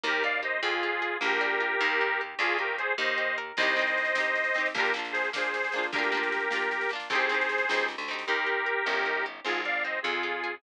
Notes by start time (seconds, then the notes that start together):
0.04 D#2 A#3 G4 A#4
0.23 D#4 D5 F5
0.43 G4 C5 D#5
0.62 F2 C4 F4 G#4
0.83 F4
1.02 G#4
1.21 A#1 A#3 G4 A#4
1.41 D4
1.60 F4
1.81 D#2 A#3
2.01 D#4
2.21 G4
2.39 D2 D4 F4 G#4
2.58 F4 G4 A#4
2.78 G#4 C5
2.98 D#2 D#4 C5 D#5
3.18 G4
3.38 A#4
3.57 C2 C4 D#4 C5 D#5, kick, snare, crash
3.63 G4
3.67 snare
3.76 C4 D#4, snare
3.82 G4
3.87 snare
3.98 snare
4.05 snare
4.15 C4 D#4, snare
4.20 G4
4.24 snare
4.35 snare
4.44 snare
4.54 C4 D#4, snare
4.60 G4
4.66 snare
4.74 A#1 A#3 D4 G4 A#4, kick, snare
4.80 F4
4.85 snare
4.94 A#3 D4, snare
4.99 F4
5.05 snare
5.12 G#4 C5, snare
5.24 snare
5.33 A#3 D4 G#4 C5, snare
5.38 F4
5.43 snare
5.54 snare
5.64 snare
5.72 A#3 D4, snare
5.78 F4
5.83 snare
5.92 D2 A#3 D4 G4 A#4, kick, snare
5.98 F4
6.03 snare
6.12 A#3 D4, snare
6.17 F4
6.23 snare
6.32 snare
6.40 snare
6.51 A#3 D4, snare
6.55 F4
6.62 snare
6.71 snare
6.81 snare
6.89 A#3 D4, snare
6.95 F4
7.00 snare
7.10 C2 C4 D#4 G#4 C5, kick, snare
7.15 G4
7.19 snare
7.29 C4 D#4, snare
7.34 G4
7.41 snare
7.49 snare
7.58 snare
7.69 C#2 C4 D#4, snare
7.74 G4
7.79 snare
7.88 snare
7.98 D2, snare
8.08 C4 D#4, snare
8.13 G4
8.19 snare
8.27 D#2 D#4 G4 A#4
8.46 G4
8.66 A#4
8.86 G1 C#4
9.06 D#4
9.26 G4
9.45 G#1 C4 F4 G#4
9.64 G#4 D5 F5
9.84 C4 C5 D#5
10.02 F2 C4 F4 G#4
10.23 F4
10.44 G#4